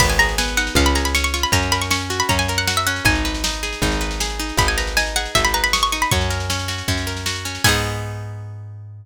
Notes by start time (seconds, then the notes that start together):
0.00 G#1 B3 B5, kick, snare, crash
0.10 G#5, snare
0.19 G#4 A#5, snare
0.29 snare
0.38 B3 G#5, snare
0.48 snare
0.57 D#4 F#5, snare
0.67 snare
0.75 C#2 C#4 F5, kick, snare
0.86 B5, snare
0.95 G#4 A#5, snare
1.05 B5, snare
1.15 C#4 C#6, snare
1.24 C#6, snare
1.34 F4 C#6, snare
1.43 B5, snare
1.52 F#2 C#4 A#5, kick, snare
1.62 snare
1.72 A#4 B5, snare
1.82 C#6, snare
1.91 C#4 C#6, snare
2.01 snare
2.10 F#4, snare
2.20 B5, snare
2.29 F#2 C#4 A#5, kick, snare
2.39 G#5, snare
2.48 A#4, snare
2.58 F#5, snare
2.67 F#4 F#5, snare
2.77 E5, snare
2.87 C#4 F#5, snare
2.96 snare
3.05 G#1 D#4 G#5, kick, snare
3.15 snare
3.25 B4, snare
3.34 snare
3.44 D#4, snare
3.54 snare
3.63 G#4, snare
3.73 snare
3.82 G#1 D#4, kick, snare
3.92 snare
4.01 B4, snare
4.11 snare
4.20 G#4, snare
4.30 snare
4.39 D#4, snare
4.49 snare
4.57 G#1 D#4 B5, kick, snare
4.68 G#5, snare
4.78 B4 A#5, snare
4.87 snare
4.97 D#4 G#5, snare
5.06 snare
5.16 G#4 F#5, snare
5.25 snare
5.35 G#1 D#4 E5, kick, snare
5.45 B5, snare
5.54 B4 A#5, snare
5.64 B5, snare
5.73 G#4 C#6, snare
5.83 C#6, snare
5.92 D#4 C#6, snare
6.02 B5, snare
6.11 F#2 C#4 C#6, kick, snare
6.21 snare
6.30 A#4, snare
6.40 snare
6.50 C#4, snare
6.59 snare
6.68 F#4, snare
6.78 snare
6.88 F#2 C#4, kick, snare
6.97 snare
7.07 A#4, snare
7.17 snare
7.26 F#4, snare
7.36 snare
7.45 C#4, snare
7.55 snare
7.64 G#2 B3 D#4 G#5, kick, crash
7.69 G#4